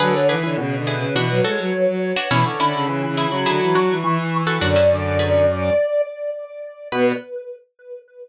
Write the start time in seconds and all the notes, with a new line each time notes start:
0.00 D3 F#3 G#4 B4
0.15 C#5
0.29 E3 G#4 B4
0.43 D3 E3 B4
0.57 B2 C#3
0.76 D3
0.87 E4 G#4 B4
0.97 C#3
1.14 B2 E3 D4 F#4
1.30 F#3
1.44 G#3 F#4 A4 C#5
1.59 F#3
1.74 F#3
1.87 F#3
2.16 D4 F#4 C#5
2.30 B2 E3 C#4 E4 B5
2.45 D3 C#6
2.60 D3 C#4 E4 B5
2.74 C#3 B5
2.87 C#3 E3
3.03 E3
3.07 C#3
3.17 E4 G#4 B5
3.27 C#3
3.32 F#3
3.46 D3 E4 G#4
3.62 E3
3.75 F#3 D4 F#4 C#6
3.90 E3
4.04 E3
4.18 E3
4.47 F#4 A4 C#6
4.61 F#2 D3 D4 F#4 D5
4.76 C#4 E4
4.90 D3
5.19 G#4 B4
6.92 B2 B3 B4